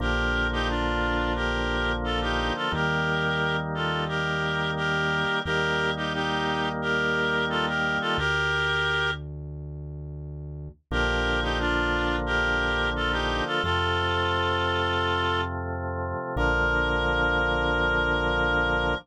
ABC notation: X:1
M:4/4
L:1/16
Q:1/4=88
K:Bb
V:1 name="Clarinet"
[GB]3 [EG] [DF]4 [GB]4 [FA] [EG]2 [FA] | [GB]6 [FA]2 [GB]4 [GB]4 | [GB]3 [EG] [EG]4 [GB]4 [FA] [GB]2 [FA] | [GB]6 z10 |
[GB]3 [EG] [DF]4 [GB]4 [FA] [EG]2 [FA] | [FA]12 z4 | B16 |]
V:2 name="Drawbar Organ"
[D,F,B,]16 | [E,G,B,]16 | [E,G,B,]16 | z16 |
[D,F,B,]16 | [C,F,A,]16 | [D,F,B,]16 |]
V:3 name="Synth Bass 1" clef=bass
B,,,16 | E,,16 | E,,16 | D,,16 |
B,,,16 | F,,16 | B,,,16 |]